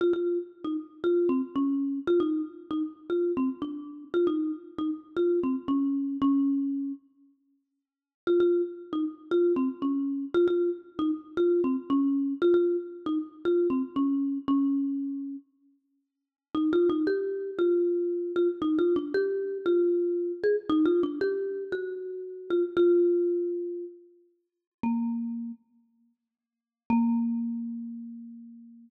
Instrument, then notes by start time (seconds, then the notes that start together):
marimba
0.01 F4
0.13 F4
0.64 D#4
1.04 F4
1.29 C4
1.56 C#4
2.07 F4
2.20 D#4
2.71 D#4
3.10 F4
3.37 C4
3.62 D4
4.14 F4
4.27 D#4
4.78 D#4
5.16 F4
5.43 C4
5.68 C#4
6.22 C#4
8.27 F4
8.40 F4
8.93 D#4
9.31 F4
9.56 C4
9.82 C#4
10.34 F4
10.48 F4
10.99 D#4
11.37 F4
11.64 C4
11.90 C#4
12.42 F4
12.54 F4
13.06 D#4
13.45 F4
13.70 C4
13.96 C#4
14.48 C#4
16.55 D#4
16.73 F4
16.90 D#4
17.07 G4
17.59 F4
18.36 F4
18.62 D#4
18.79 F4
18.96 D4
19.14 G4
19.66 F4
20.44 G#4
20.70 D#4
20.85 F4
21.03 D4
21.21 G4
21.72 F#4
22.50 F4
22.77 F4
24.83 A#3
26.90 A#3